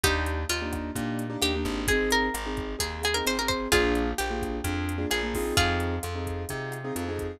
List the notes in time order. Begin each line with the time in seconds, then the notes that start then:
0.03 D#2 A#3 D4 D#4 G4, kick, cross-stick, closed hi-hat
0.26 closed hi-hat
0.49 D#2 F4, closed hi-hat
0.62 A#3 D4 D#4 G4
0.73 kick, cross-stick, closed hi-hat
0.95 A#2 A#3 D4 D#4 G4, kick, closed hi-hat
1.19 closed hi-hat
1.30 A#3 D4 D#4 G4
1.41 D#2 A#3 D4 D#4 G4, cross-stick, closed hi-hat
1.55 A#3 D4 D#4 G4
1.65 G#1, kick, closed hi-hat
1.87 C4 D#4 G#4, kick, closed hi-hat
2.10 A#4, closed hi-hat
2.34 G#1, cross-stick, closed hi-hat
2.46 C4 D#4 G#4
2.57 kick, closed hi-hat
2.79 D#2 C4 D#4 G#4, kick, closed hi-hat
3.03 G#4, cross-stick, closed hi-hat
3.14 C4 D#4 G#4 A#4
3.26 G#1 C4 D#4 G#4 C5, closed hi-hat
3.39 C4 D#4 G#4 A#4
3.48 C5, kick, closed hi-hat
3.72 A#1 A#3 D4 F4 G#4, kick, cross-stick, closed hi-hat
3.95 closed hi-hat
4.18 A#1 G4, closed hi-hat
4.30 A#3 D4 F4 G#4
4.42 kick, cross-stick, closed hi-hat
4.64 F2 A#3 D4 F4 G#4, kick, closed hi-hat
4.89 closed hi-hat
4.98 A#3 D4 F4 G#4
5.10 A#1 A#3 D4 F4 G#4, cross-stick, closed hi-hat
5.23 A#3 D4 F4 G#4
5.34 C4 D#4 F4 G#4, kick, open hi-hat
5.57 F2 F4 G#4, kick, closed hi-hat
5.80 closed hi-hat
6.03 F2, cross-stick, closed hi-hat
6.15 C4 D#4 F4 G#4
6.27 kick, closed hi-hat
6.49 C3 C4 D#4 F4 G#4, kick, closed hi-hat
6.72 cross-stick, closed hi-hat
6.84 C4 D#4 F4 G#4
6.95 F2 C4 D#4 F4 G#4, closed hi-hat
7.08 C4 D#4 F4 G#4
7.19 kick, closed hi-hat